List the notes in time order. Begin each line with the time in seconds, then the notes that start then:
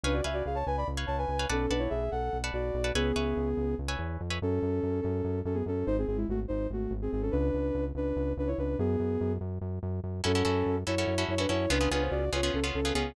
0.03 C#2 D4 B4 C#5 F5 G#5
0.13 F#4 D5
0.24 C#2 B4 C#5 E5 F5 G#5
0.33 F#4 D5
0.46 C#2 G#4 F5
0.55 C#5 A5
0.66 C#2 B4 G#5
0.77 D5 B5
0.88 C#2
0.97 B4 C#5 F5 G#5
1.07 C#2 C#5 A5
1.18 B4 G#5
1.28 C#2
1.39 B4 C#5 F5 G#5
1.49 B1 C#4 A4 B4 D5 F#5 A5
1.70 B1 D4 B4 D5 F#5 A5
1.79 E4 C#5
1.90 B1 G#4 E5
2.11 B1 A4 F#5
2.33 B1
2.44 B4 D5 F#5 A5
2.53 B1 F#4 D5
2.74 B1
2.84 B4 D5 F#5 A5
2.95 C#2 B3 G#4 B4 C#5 E5 G#5
3.16 C#2 B4 C#5 E5 G#5
3.37 C#2
3.57 C#2
3.78 C#2
3.88 B4 C#5 E5 G#5
3.99 E2
4.21 F2
4.30 B4 C#5 E5 G#5
4.42 F#2 C#4 A4
4.62 F#2
4.83 F#2
5.01 F#2 C#4 A4
5.24 F#2
5.45 F#2 C#4 A4
5.54 B3 G#4
5.66 F#2 C#4 A4
5.87 G#1 D#4 C5
5.98 C4 G#4
6.07 G#1 C4 G#4
6.17 G#3 E4
6.28 G#1 A3 F#4
6.48 G#1 D#4 C5
6.70 G#1 A3 F#4
6.91 G#1
7.02 C4 G#4
7.12 G#1 C4 G#4
7.22 C#4 A4
7.31 C#2 D4 B4
7.54 C#2
7.75 C#2
7.95 C#2 D4 B4
8.16 C#2
8.37 C#2 D4 B4
8.47 E4 C#5
8.58 C#2 D4 B4
8.79 F#2 B3 G#4
9.00 F#2
9.21 F#2
9.41 F#2
9.61 F#2
9.83 F#2
10.04 F#2
10.24 F#2 C#4 E4 F#4 A4
10.35 C#4 E4 F#4 A4
10.45 F#2 C#4 E4 F#4 A4
10.66 F#2
10.87 F#2 C#4 E4 F#4 A4 C#5
10.98 C#4 E4 F#4 A4
11.07 F#2
11.18 C#4 E4 F#4 A4
11.28 F#2 E4 C#5
11.38 C#4 D4 E4 F#4 A4 B4
11.49 F#2 C#4 E4 F#4 A4 C#5
11.70 C#2 B3 C#4 D4 F4 G#4 B4
11.81 B3 C#4 F4 G#4
11.91 C#2 B3 C#4 D4 F4 G#4 B4
12.02 C5
12.11 C#2 F#4 D5
12.32 C#2 B3 C#4 F4 G#4 C#5
12.43 B3 C#4 F4 G#4
12.54 C#2 C#4 A4
12.64 B3 C#4 F4 G#4
12.75 C#2 C#4 A4
12.85 B3 C#4 F4 G#4
12.93 C#2 B3 C#4 F4 G#4